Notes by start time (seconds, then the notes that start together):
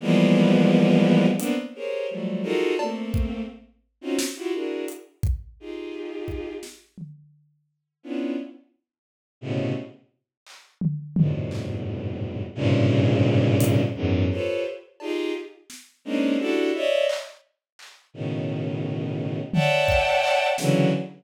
0.01 E3 F3 G3 G#3 A#3 B3
1.38 A#3 B3 C4 D4, closed hi-hat
1.75 G4 G#4 A#4 C5 C#5
2.10 F3 F#3 G3 A3
2.43 D#4 F4 F#4 G#4 A4 A#4
2.79 A3 A#3 C4, cowbell
3.14 kick
4.01 C4 C#4 D#4 F4 F#4
4.19 snare
4.36 E4 F4 F#4 G4
4.53 D4 E4 F#4 G#4 A#4
4.88 closed hi-hat
5.23 kick
5.60 D#4 F4 G4 G#4
6.28 kick
6.63 snare
6.98 floor tom
8.03 B3 C#4 D4 E4 F4
9.41 A2 B2 C3 C#3
10.47 clap
10.81 floor tom
11.16 F2 G2 G#2 A2 B2 C3, floor tom
11.51 clap
12.55 G2 G#2 A#2 C3 C#3
13.60 closed hi-hat
13.95 E2 F#2 G#2
14.31 F4 G4 A4 B4 C5 C#5
15.00 D#4 F4 G4 G#4, cowbell
15.70 snare
16.05 G#3 A#3 C4 C#4 D4 D#4
16.39 D4 E4 F#4 G4 A4
16.74 C#5 D5 D#5 E5
17.09 clap
17.79 clap
18.14 A2 B2 C#3 D#3
19.53 C#5 D5 E5 F#5 G5 A5, floor tom
19.88 kick
20.23 clap
20.58 C#3 D3 E3 F#3, snare